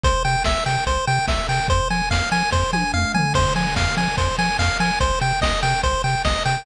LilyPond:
<<
  \new Staff \with { instrumentName = "Lead 1 (square)" } { \time 4/4 \key f \minor \tempo 4 = 145 c''8 g''8 e''8 g''8 c''8 g''8 e''8 g''8 | c''8 aes''8 f''8 aes''8 c''8 aes''8 f''8 aes''8 | c''8 aes''8 f''8 aes''8 c''8 aes''8 f''8 aes''8 | c''8 g''8 ees''8 g''8 c''8 g''8 ees''8 g''8 | }
  \new Staff \with { instrumentName = "Synth Bass 1" } { \clef bass \time 4/4 \key f \minor c,8 c8 c,8 c8 c,8 c8 c,8 c8 | f,8 f8 f,8 f8 f,8 f8 f,8 f8 | f,8 f8 f,8 f8 f,8 f8 f,8 f8 | c,8 c8 c,8 c8 c,8 c8 c,8 c8 | }
  \new DrumStaff \with { instrumentName = "Drums" } \drummode { \time 4/4 <hh bd>8 hho8 <bd sn>8 hho8 <hh bd>8 hho8 <bd sn>8 hho8 | <hh bd>8 hho8 <bd sn>8 hho8 <bd sn>8 tommh8 toml8 tomfh8 | <cymc bd>8 hho8 <bd sn>8 hho8 <hh bd>8 hho8 <bd sn>8 hho8 | <hh bd>8 hho8 <bd sn>8 hho8 <hh bd>8 hho8 <bd sn>8 hho8 | }
>>